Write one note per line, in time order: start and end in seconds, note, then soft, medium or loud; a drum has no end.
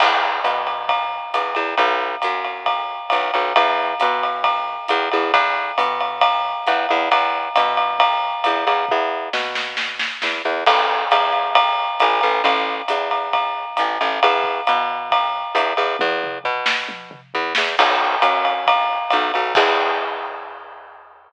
0.00 0.40 E2 medium
0.00 kick medium
0.00 crash loud
0.00 ride loud
0.44 1.20 B2 medium
0.44 hi-hat pedal medium
0.44 ride medium
0.67 ride medium
0.89 kick medium
0.89 ride medium
1.34 1.54 E2 medium
1.34 hi-hat pedal medium
1.34 ride medium
1.55 1.75 E2 medium
1.55 ride medium
1.77 2.16 B1 medium
1.77 kick medium
1.77 ride medium
2.22 3.00 F#2 medium
2.22 hi-hat pedal medium
2.22 ride medium
2.45 ride medium
2.66 kick medium
2.66 ride medium
3.10 3.31 B1 medium
3.10 hi-hat pedal medium
3.10 ride medium
3.34 3.53 B1 medium
3.34 ride medium
3.56 3.94 E2 medium
3.56 kick medium
3.56 ride loud
4.00 4.78 B2 medium
4.00 hi-hat pedal medium
4.00 ride medium
4.23 ride medium
4.44 kick medium
4.44 ride loud
4.88 5.09 E2 medium
4.88 hi-hat pedal medium
4.88 ride medium
5.11 5.32 E2 medium
5.11 ride medium
5.34 5.72 E2 loud
5.34 kick medium
5.34 ride loud
5.78 6.54 B2 medium
5.78 hi-hat pedal medium
5.78 ride medium
6.00 ride medium
6.21 kick medium
6.21 ride loud
6.67 6.87 E2 medium
6.67 hi-hat pedal medium
6.67 ride medium
6.89 7.09 E2 medium
6.89 ride medium
7.11 7.49 E2 medium
7.11 kick medium
7.11 ride loud
7.56 8.32 B2 medium
7.56 hi-hat pedal medium
7.56 ride loud
7.77 ride medium
7.99 kick medium
7.99 ride loud
8.44 8.65 E2 medium
8.44 hi-hat pedal medium
8.44 ride medium
8.67 8.86 E2 medium
8.67 ride medium
8.89 9.29 E2 medium
8.89 kick medium
9.33 10.09 B2 medium
9.33 snare medium
9.55 snare medium
9.77 snare medium
9.99 snare medium
10.22 10.42 E2 medium
10.22 snare medium
10.45 10.64 E2 medium
10.66 11.05 A1 medium
10.66 kick medium
10.66 crash loud
10.66 ride loud
11.11 11.88 E2 medium
11.11 hi-hat pedal medium
11.11 ride loud
11.33 ride medium
11.55 kick medium
11.55 ride loud
12.00 12.21 A1 medium
12.00 hi-hat pedal medium
12.00 ride loud
12.21 12.42 A1 medium
12.21 ride medium
12.44 12.82 A1 loud
12.44 kick medium
12.44 ride loud
12.88 13.65 E2 medium
12.88 hi-hat pedal loud
12.88 ride medium
13.11 ride medium
13.33 kick medium
13.33 ride medium
13.77 13.98 A1 medium
13.77 hi-hat pedal medium
13.77 ride medium
14.01 14.20 A1 medium
14.01 ride medium
14.23 14.61 E2 medium
14.23 ride loud
14.44 kick medium
14.67 15.44 B2 medium
14.67 hi-hat pedal medium
14.67 ride medium
15.11 kick medium
15.11 ride loud
15.55 15.74 E2 medium
15.55 hi-hat pedal medium
15.55 ride medium
15.77 15.97 E2 medium
15.77 ride medium
15.99 16.39 E2 loud
15.99 kick medium
15.99 high tom medium
16.23 mid tom medium
16.44 17.21 B2 medium
16.44 floor tom medium
16.66 snare loud
16.89 high tom medium
17.11 mid tom loud
17.34 17.54 E2 medium
17.34 floor tom medium
17.55 17.76 E2 medium
17.55 snare loud
17.79 18.16 B1 medium
17.79 kick medium
17.79 crash loud
17.79 ride loud
18.22 18.98 F#2 medium
18.22 hi-hat pedal medium
18.22 ride loud
18.45 ride medium
18.67 kick medium
18.67 ride loud
19.10 19.32 B1 medium
19.10 hi-hat pedal medium
19.10 ride medium
19.34 19.54 B1 medium
19.34 ride medium
19.55 21.28 E2 loud
19.55 kick loud
19.55 crash loud